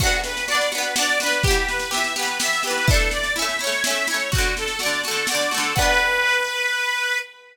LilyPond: <<
  \new Staff \with { instrumentName = "Accordion" } { \time 3/4 \key b \minor \tempo 4 = 125 fis'8 b'8 d''8 b'8 d''8 b'8 | g'8 b'8 e''8 b'8 e''8 b'8 | a'8 d''8 e''8 cis''8 e''8 cis''8 | fis'8 a'8 d''8 a'8 d''8 a'8 |
b'2. | }
  \new Staff \with { instrumentName = "Pizzicato Strings" } { \time 3/4 \key b \minor <b d' fis'>4 <b d' fis'>8 <b d' fis'>8 <b d' fis'>8 <b d' fis'>8 | <e b g'>4 <e b g'>8 <e b g'>8 <e b g'>8 <e b g'>8 | <a d' e'>4 <a cis' e'>8 <a cis' e'>8 <a cis' e'>8 <a cis' e'>8 | <d a fis'>4 <d a fis'>8 <d a fis'>8 <d a fis'>8 <d a fis'>8 |
<b d' fis'>2. | }
  \new DrumStaff \with { instrumentName = "Drums" } \drummode { \time 3/4 <cymc bd sn>16 sn16 sn16 sn16 sn16 sn16 sn16 sn16 sn16 sn16 sn16 sn16 | <bd sn>16 sn16 sn16 sn16 sn16 sn16 sn16 sn16 sn16 sn16 sn16 sn16 | <bd sn>16 sn16 sn16 sn16 sn16 sn16 sn16 sn16 sn16 sn16 sn16 sn16 | <bd sn>16 sn16 sn16 sn16 sn16 sn16 sn16 sn16 sn16 sn16 sn16 sn16 |
<cymc bd>4 r4 r4 | }
>>